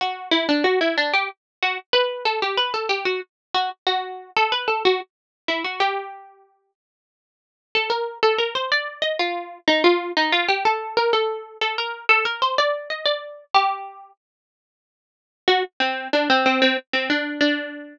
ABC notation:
X:1
M:3/4
L:1/16
Q:1/4=93
K:Dmix
V:1 name="Pizzicato Strings"
F2 E D F E D G z2 F z | B2 A G B A G F z2 F z | F3 A B A F z3 E F | G6 z6 |
[K:Fmix] A B2 A B c d2 e F3 | E F2 E F G A2 B A3 | A B2 A B c d2 e d3 | G4 z8 |
[K:Dmix] F z C2 D C C C z C D2 | D4 z8 |]